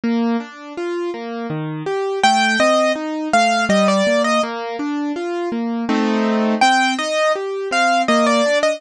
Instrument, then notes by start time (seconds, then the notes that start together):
acoustic grand piano
0.04 A#3
0.40 D4
0.77 F4
1.14 A#3
1.50 D#3
1.86 G4
2.23 A3 G5
2.60 C4 D#5
2.95 D#4
3.33 A3 F5
3.69 G3 D#5
3.88 D5
4.07 A#3
4.24 D#5
4.43 A#3
4.79 D4
5.16 F4
5.52 A#3
5.89 A3 C4 D#4
6.61 C4 G5
6.99 D#4 D#5
7.36 G4
7.71 C4 F5
8.08 A#3 D#5
8.27 D5
8.46 D4
8.63 D#5